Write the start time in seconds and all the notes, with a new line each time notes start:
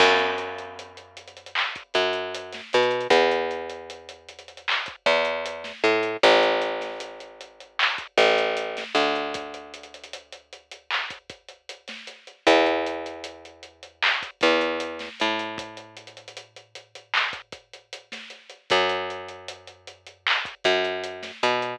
0.00 F#2, kick, crash
0.19 closed hi-hat
0.38 closed hi-hat
0.58 closed hi-hat
0.79 closed hi-hat
0.97 closed hi-hat
1.17 closed hi-hat
1.28 closed hi-hat
1.37 closed hi-hat
1.46 closed hi-hat
1.55 clap
1.75 kick, closed hi-hat
1.94 F#2, kick, closed hi-hat
2.13 closed hi-hat
2.35 closed hi-hat
2.53 snare, closed hi-hat
2.73 B2, closed hi-hat
2.83 closed hi-hat
2.91 closed hi-hat
3.01 closed hi-hat
3.10 E2, kick, closed hi-hat
3.31 closed hi-hat
3.51 closed hi-hat
3.70 closed hi-hat
3.90 closed hi-hat
4.09 closed hi-hat
4.29 closed hi-hat
4.39 closed hi-hat
4.48 closed hi-hat
4.57 closed hi-hat
4.68 clap
4.86 kick, closed hi-hat
5.06 E2, kick, closed hi-hat
5.25 closed hi-hat
5.46 closed hi-hat
5.64 snare, closed hi-hat
5.84 A2, closed hi-hat
6.03 closed hi-hat
6.23 A1, kick, closed hi-hat
6.43 closed hi-hat
6.62 closed hi-hat
6.81 snare, closed hi-hat
7.00 closed hi-hat
7.20 closed hi-hat
7.41 closed hi-hat
7.60 closed hi-hat
7.79 clap
7.98 kick, closed hi-hat
8.18 A1, kick, closed hi-hat
8.38 closed hi-hat
8.57 closed hi-hat
8.77 snare, closed hi-hat
8.95 D2, closed hi-hat
9.15 closed hi-hat
9.34 kick, closed hi-hat
9.54 closed hi-hat
9.74 closed hi-hat
9.83 closed hi-hat
9.94 closed hi-hat
10.04 closed hi-hat
10.13 closed hi-hat
10.32 closed hi-hat
10.53 closed hi-hat
10.71 closed hi-hat
10.91 clap
11.10 kick, closed hi-hat
11.30 kick, closed hi-hat
11.49 closed hi-hat
11.69 closed hi-hat
11.88 snare, closed hi-hat
12.07 closed hi-hat
12.27 closed hi-hat
12.47 E2, kick, closed hi-hat
12.66 closed hi-hat
12.87 closed hi-hat
13.06 closed hi-hat
13.24 closed hi-hat
13.45 closed hi-hat
13.63 closed hi-hat
13.83 closed hi-hat
14.02 clap
14.23 kick, closed hi-hat
14.41 E2, kick, closed hi-hat
14.61 closed hi-hat
14.80 closed hi-hat
14.99 snare, closed hi-hat
15.20 A2, closed hi-hat
15.39 closed hi-hat
15.58 kick, closed hi-hat
15.77 closed hi-hat
15.97 closed hi-hat
16.07 closed hi-hat
16.17 closed hi-hat
16.28 closed hi-hat
16.37 closed hi-hat
16.56 closed hi-hat
16.75 closed hi-hat
16.95 closed hi-hat
17.14 clap
17.33 kick, closed hi-hat
17.52 kick, closed hi-hat
17.73 closed hi-hat
17.93 closed hi-hat
18.12 snare, closed hi-hat
18.30 closed hi-hat
18.50 closed hi-hat
18.70 F#2, kick, closed hi-hat
18.89 closed hi-hat
19.10 closed hi-hat
19.29 closed hi-hat
19.48 closed hi-hat
19.67 closed hi-hat
19.87 closed hi-hat
20.06 closed hi-hat
20.27 clap
20.45 kick, closed hi-hat
20.64 F#2, kick, closed hi-hat
20.85 closed hi-hat
21.04 closed hi-hat
21.23 snare, closed hi-hat
21.43 B2, closed hi-hat
21.62 closed hi-hat